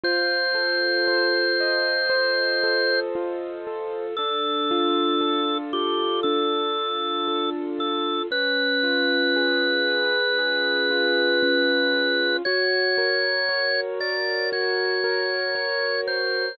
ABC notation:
X:1
M:4/4
L:1/8
Q:1/4=58
K:Bb
V:1 name="Drawbar Organ"
c7 z | A3 G A3 A | _c8 | _d3 =d _d3 c |]
V:2 name="Acoustic Grand Piano"
F A c e c A F A | D F A F D F A F | _D F _A _c A F D F | _G B _d B G B d B |]